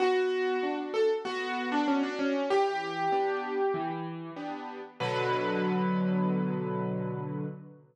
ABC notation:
X:1
M:4/4
L:1/16
Q:1/4=96
K:Bm
V:1 name="Acoustic Grand Piano"
F6 A z F3 D C D C2 | G10 z6 | B16 |]
V:2 name="Acoustic Grand Piano"
B,4 [DF]4 B,4 [DF]4 | E,4 [B,DG]4 E,4 [B,DG]4 | [B,,D,F,]16 |]